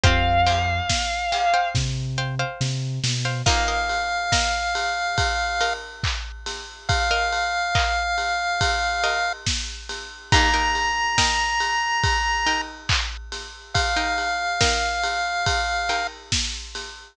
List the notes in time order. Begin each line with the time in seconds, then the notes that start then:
0.03 F2 C4 F4 G4 C5 F5 G5, kick, closed hi-hat
0.46 C5 F5 G5, open hi-hat
0.89 kick, snare
1.32 C5 F5 G5, open hi-hat
1.54 C5 F5 G5
1.75 C3, kick, snare
2.18 C5 F5 G5
2.39 C5 F5 G5
2.61 C3, snare
3.04 B2, snare
3.25 C5 F5 G5
3.46 A#3 D#4 F4 A#4 D#5 F5, kick, crash
3.68 A#4 D#5 F5
3.89 ride
4.32 A#4 D#5 F5, kick, snare
4.75 ride
5.18 kick, ride
5.61 A#4 D#5 F5, ride
6.03 kick, clap
6.46 snare, ride
6.89 F5, kick, ride
7.11 A#4 D#5 F5
7.33 ride
7.75 A#4 D#5 F5, kick, clap
8.18 ride
8.61 kick, ride
9.04 A#4 D#5 F5, ride
9.46 kick, snare
9.89 snare, ride
10.32 D#3 A#3 D#4 G4 A#4 G5 A#5, kick, ride
10.54 D#4 A#4 G5
10.75 ride
11.18 D#4 A#4 G5, kick, snare
11.60 ride
12.04 kick, ride
12.46 D#4 A#4 G5, ride
12.89 kick, clap
13.32 snare, ride
13.74 F5, kick, ride
13.96 D#4 A#4 G5
14.18 ride
14.61 D#4 A#4 G5, kick, snare
15.04 ride
15.46 kick, ride
15.89 D#4 A#4 G5, ride
16.32 kick, snare
16.75 snare, ride